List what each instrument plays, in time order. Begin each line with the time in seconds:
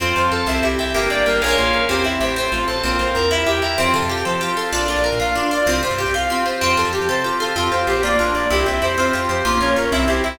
0.00 electric bass (finger) F2, pizzicato strings C4, pad 5 (bowed) C4 F4 A4, ocarina F4, drawbar organ C5
0.16 electric bass (finger) F2, pizzicato strings F4, ocarina C5, drawbar organ F5
0.31 electric bass (finger) F2, pizzicato strings A4, ocarina A4, drawbar organ A5
0.46 electric bass (finger) C2, pad 5 (bowed) C4 E4 G4, pizzicato strings C4, drawbar organ C5, ocarina E5
0.63 electric bass (finger) C2, pizzicato strings E4, ocarina G4, drawbar organ E5
0.79 electric bass (finger) C2, pizzicato strings G4, ocarina E5, drawbar organ G5
0.94 electric bass (finger) G1, pizzicato strings A#3, pad 5 (bowed) A#3 D4 G4, ocarina G4, drawbar organ A#4
1.10 electric bass (finger) G1, pizzicato strings G4, ocarina D5, drawbar organ D5
1.26 electric bass (finger) G1, pizzicato strings A#3, ocarina A#4, drawbar organ G5
1.41 electric bass (finger) A#1, pad 5 (bowed) A#3 C#4 F4 G#4, pizzicato strings F4 G#4, ocarina A#4, drawbar organ A#4 C#5 F5 G#5
1.46 pizzicato strings A#3 C#4
1.57 electric bass (finger) A#1, ocarina F4
1.73 electric bass (finger) A#1, ocarina A#4
1.89 electric bass (finger) E2, pad 5 (bowed) C4 E4 G4, pizzicato strings C4, ocarina G4, drawbar organ C5
2.04 electric bass (finger) E2, pizzicato strings E4, drawbar organ E5, ocarina E5
2.20 electric bass (finger) A1, pizzicato strings G4, ocarina C5, drawbar organ G5
2.36 pad 5 (bowed) C4 F4 A4, pizzicato strings C4, drawbar organ C5, ocarina C5
2.52 electric bass (finger) A1, pizzicato strings F4, ocarina F4, drawbar organ F5
2.68 electric bass (finger) A1, pizzicato strings A4, ocarina C5, drawbar organ A5
2.83 electric bass (finger) A#1, pad 5 (bowed) C4 F4 A#4, pizzicato strings C4, ocarina F4, drawbar organ C5
2.99 electric bass (finger) A#1, pizzicato strings F4, ocarina C5, drawbar organ F5
3.15 electric bass (finger) E2, pizzicato strings A#4, ocarina A#4, drawbar organ A#5
3.30 pad 5 (bowed) E4 G4 A#4, pizzicato strings E4, drawbar organ E5, ocarina E5
3.46 electric bass (finger) E2, pizzicato strings G4, ocarina G4, drawbar organ G5
3.62 electric bass (finger) E2, pizzicato strings A#4, ocarina E5, drawbar organ A#5
3.78 electric bass (finger) F2, pizzicato strings C4, pad 5 (bowed) C4 F4 G4 A4, ocarina F4
3.94 electric bass (finger) C3, pizzicato strings F4, ocarina A4
4.02 electric bass (finger) F2
4.09 pizzicato strings G4, ocarina G4
4.17 electric bass (finger) F2
4.25 electric bass (finger) F3, pizzicato strings A4, ocarina C5
4.41 ocarina F4, pizzicato strings G4
4.56 pizzicato strings F4, ocarina A4
4.72 electric bass (finger) A#1, pizzicato strings D4, pad 5 (bowed) D4 F4 A#4, ocarina F4
4.88 electric bass (finger) A#1, pizzicato strings F4, ocarina D5
4.96 electric bass (finger) A#1
5.04 pizzicato strings A#4, ocarina A#4
5.12 electric bass (finger) A#2
5.20 electric bass (finger) A#1, pizzicato strings F4, ocarina F5
5.35 pizzicato strings D4, ocarina F4
5.51 pizzicato strings F4, ocarina D5
5.66 electric bass (finger) C2, pizzicato strings C4, pad 5 (bowed) C4 F4 G4, ocarina F4
5.83 electric bass (finger) C3, pizzicato strings F4, ocarina C5
5.91 electric bass (finger) G2
5.98 pizzicato strings G4, ocarina G4
6.06 electric bass (finger) C2
6.14 electric bass (finger) C2, pizzicato strings F4, ocarina F5
6.30 pizzicato strings C4, ocarina F4
6.45 pizzicato strings F4, ocarina C5
6.61 electric bass (finger) F2, pizzicato strings C4, pad 5 (bowed) C4 F4 G4 A4, ocarina F4
6.77 electric bass (finger) F2, pizzicato strings F4, ocarina A4
6.85 electric bass (finger) F2
6.93 pizzicato strings G4, ocarina G4
7.01 electric bass (finger) F2
7.09 electric bass (finger) C3, pizzicato strings A4, ocarina C5
7.24 ocarina F4, pizzicato strings G4
7.40 pizzicato strings F4, ocarina A4
7.56 electric bass (finger) F2, drawbar organ C4, pad 5 (bowed) C4 F4 G4, pizzicato strings F4, ocarina F4
7.71 electric bass (finger) F2, drawbar organ F4, pizzicato strings G4, ocarina C5
7.87 electric bass (finger) A#1, drawbar organ G4, ocarina G4, pizzicato strings C5
8.03 pad 5 (bowed) A#3 D4 F4, drawbar organ A#3, pizzicato strings F4, ocarina D5
8.19 electric bass (finger) A#1, drawbar organ D4, ocarina F4, pizzicato strings A#4
8.34 electric bass (finger) A#1, drawbar organ F4, pizzicato strings D5, ocarina D5
8.50 electric bass (finger) C2, drawbar organ C4, pad 5 (bowed) C4 E4 G4, pizzicato strings E4, ocarina G4
8.66 electric bass (finger) C2, drawbar organ E4, pizzicato strings C5, ocarina E5
8.82 electric bass (finger) F2, pizzicato strings E4, drawbar organ G4, ocarina C5
8.98 drawbar organ C4, pad 5 (bowed) C4 F4 G4, pizzicato strings F4, ocarina C5
9.13 electric bass (finger) F2, ocarina F4, drawbar organ F4, pizzicato strings G4
9.29 electric bass (finger) F2, drawbar organ G4, ocarina C5, pizzicato strings C5
9.45 electric bass (finger) A#1, drawbar organ A#3, pad 5 (bowed) A#3 C#4 F4, pizzicato strings F4, ocarina F4
9.60 electric bass (finger) A#1, drawbar organ C#4, pizzicato strings A#4, ocarina C#5
9.76 electric bass (finger) A#1, drawbar organ F4, ocarina A#4, pizzicato strings C#5
9.92 electric bass (finger) C2, pad 5 (bowed) C4 E4 G4, drawbar organ C4, pizzicato strings E4, ocarina E5
10.08 electric bass (finger) C2, drawbar organ E4, ocarina G4, pizzicato strings C5
10.24 electric bass (finger) C2, pizzicato strings E4, drawbar organ G4, ocarina E5